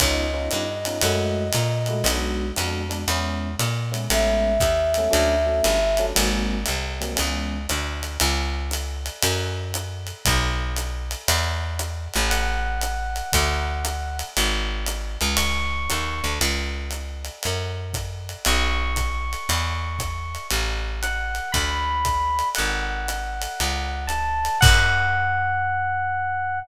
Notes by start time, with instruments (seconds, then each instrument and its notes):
0.00 electric bass (finger) C#2, electric piano 1 B3 C#4 D#4 F4, flute D#5, kick, ride
0.33 electric piano 1 B3 C#4 D#4 F4
0.51 electric bass (finger) G2, hi-hat pedal, ride
0.85 electric piano 1 B3 C#4 D#4 F4, ride
1.01 electric bass (finger) F#2, electric piano 1 G#3 A3 E4 F#4, ride
1.53 electric bass (finger) A#2, hi-hat pedal, ride
1.86 electric piano 1 G#3 A3 E4 F#4, ride
2.04 electric bass (finger) B1, electric piano 1 G#3 B3 D4 F#4, ride
2.56 electric bass (finger) F2, electric piano 1 G#3 B3 D4 F#4, hi-hat pedal, ride
2.89 electric piano 1 G#3 B3 D4 F#4, ride
3.08 electric bass (finger) E2, electric piano 1 G#3 B3 C#4 E4, ride
3.59 electric bass (finger) A#2, hi-hat pedal, ride
3.92 electric piano 1 G#3 B3 C#4 E4, ride
4.10 electric bass (finger) A1, electric piano 1 G#3 A3 B3 C#4, flute E5, ride
4.60 electric bass (finger) D#2, kick, hi-hat pedal, ride
4.94 electric piano 1 G#3 A3 B3 C#4, ride
5.11 electric bass (finger) D2, electric piano 1 F#3 A3 C#4 D4, ride
5.46 electric piano 1 F#3 A3 C#4 D4
5.64 electric bass (finger) G1, hi-hat pedal, ride
5.97 electric piano 1 F#3 A3 C#4 D4, ride
6.15 electric bass (finger) G#1, electric piano 1 F#3 G#3 A#3 C4, ride
6.66 electric bass (finger) C2, hi-hat pedal, ride
7.00 electric piano 1 F#3 G#3 A#3 C4, ride
7.16 electric bass (finger) C#2, electric piano 1 E3 G#3 B3 C#4, ride
7.69 electric bass (finger) D2, hi-hat pedal, ride
8.03 ride
8.20 electric bass (finger) C#2, ride
8.71 hi-hat pedal, ride
9.06 ride
9.23 electric bass (finger) F#2, ride
9.74 hi-hat pedal, ride
10.07 ride
10.25 electric bass (finger) B1, kick, ride
10.76 hi-hat pedal, ride
11.11 ride
11.28 electric bass (finger) E2, ride
11.79 hi-hat pedal, ride
12.14 electric bass (finger) A1, ride
12.30 electric piano 1 F#5, ride
12.81 hi-hat pedal, ride
13.16 ride
13.33 electric bass (finger) D2, kick, ride
13.85 hi-hat pedal, ride
14.19 ride
14.37 electric bass (finger) G#1, ride
14.86 hi-hat pedal, ride
15.21 electric bass (finger) C#2, ride
15.37 electric piano 1 C#6, ride
15.90 electric bass (finger) D#2, hi-hat pedal, ride
16.24 electric bass (finger) D2, ride
16.41 electric bass (finger) C#2, ride
16.91 hi-hat pedal, ride
17.25 ride
17.43 electric bass (finger) F#2, ride
17.93 kick, hi-hat pedal, ride
18.29 ride
18.45 electric bass (finger) B1, electric piano 1 C#6, ride
18.96 kick, hi-hat pedal, ride
19.33 ride
19.49 electric bass (finger) E2, ride
19.99 kick, hi-hat pedal, ride
20.35 ride
20.51 electric bass (finger) A1, ride
21.03 electric piano 1 F#5, hi-hat pedal, ride
21.35 ride
21.52 electric bass (finger) D2, electric piano 1 B5, kick, ride
22.05 kick, hi-hat pedal, ride
22.39 ride
22.55 electric bass (finger) G#1, electric piano 1 F#5, ride
23.08 hi-hat pedal, ride
23.42 ride
23.60 electric bass (finger) C#2, ride
24.07 electric piano 1 A5, hi-hat pedal, ride
24.45 ride
24.61 electric bass (finger) F#2, electric piano 1 F#5, kick, crash